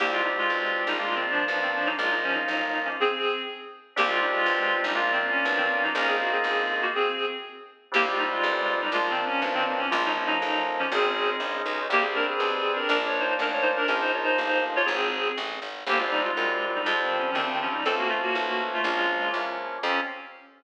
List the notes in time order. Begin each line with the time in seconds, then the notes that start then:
0.00 C2 A#3 C4 D4 G4
0.11 G#3 F4
0.24 G3 D#4
0.38 G#3 F4
0.50 B1
0.87 A#1 G3 D#4
0.99 G#3 A#3 D4 F4
1.15 D#3 C4
1.30 F3 D4
1.48 B1 F3 D4
1.62 D#3 C4
1.75 F3 D4
1.86 F#3 D#4
1.98 A#1 G#3 A#3 D#4 F4
2.11 F#3 D#4
2.23 F3 C#4
2.34 F#3 D#4
2.48 G1
2.84 F3 C#4
3.00 C4 G#4
3.96 C2 A#3 C4 D4 G4
4.07 G#3 F4
4.21 G3 D#4
4.32 G#3 F4
4.46 B1
4.82 A#1 G3 D#4
4.95 G#3 A#3 D4 F4
5.12 D#3 C4
5.30 C#4
5.45 B1 F3 D4
5.57 D#3 C4
5.72 C#4
5.83 F#3 D#4
5.95 A#1 A#3 C#4 D#4 F4 A#4
6.07 C4 G#4
6.20 A#3 F#4
6.32 C4 G#4
6.44 G1
6.81 A#3 F#4
6.94 C4 G#4
7.92 C2 G3 A#3 C4 D4 G4
8.07 G#3 F4
8.18 G3 D#4
8.31 G#3 F4
8.43 A1
8.80 G3 D#4
8.92 A#1 F3 G#3 A#3 D4 F4
9.10 D#3 C4
9.26 C#4
9.41 B1 F3 D4
9.54 D#3 C4
9.69 D#3 C4
9.79 C#4
9.90 A#1 F3 G#3 A#3 D#4 F4
10.05 F#3 D#4
10.16 F3 C#4
10.27 F#3 D#4
10.42 A1
10.78 F3 C#4
10.92 G#1 G#3 C4 C#4 D#4 G#4
11.40 A#1
11.66 B1
11.89 C2 G3 A#3 C4 D4 G4
12.02 C4 G#4
12.15 D4 A#4
12.29 C4 G#4
12.40 B1
12.76 D4 A#4
12.89 A#1 F3 A#3 D4 A#4
13.06 C#5
13.20 D#4 C5
13.39 A1 D4 A#4
13.52 C#5
13.62 D#4 C5
13.76 D4 A#4
13.88 A#1 F3 A#3 C#4 D#4 A#4
14.00 D#4 C5
14.14 F4 C#5
14.24 D#4 C5
14.38 G1
14.75 F4 C#5
14.85 G#1 C4 G#4
15.38 A1
15.62 G#1
15.87 G1 G3 A#3 C4 D4 G4
15.99 G#3 F4
16.10 G3 D#4
16.24 G#3 F4
16.37 F#2 G3 C4 D4
16.75 G3 D#4
16.86 F2 F3 G3 G#3 C4 F4
17.02 D#3 C4
17.19 F3 C#4
17.34 D2 D#3 F3 G3 C4
17.48 D#3 C4
17.62 F3 C#4
17.72 G3 D#4
17.85 C#2 F3 A3 C4 C#4 A4
17.97 A#3 F#4
18.09 A3 F4
18.21 A#3 F#4
18.35 B1 F3 A3 C#4
18.73 A3 F4
18.84 A#1 F3 G#3 A#3 C#4 F4
19.33 E2 F3 A#3 C#4
19.82 F2 C4 C#4 F4 G4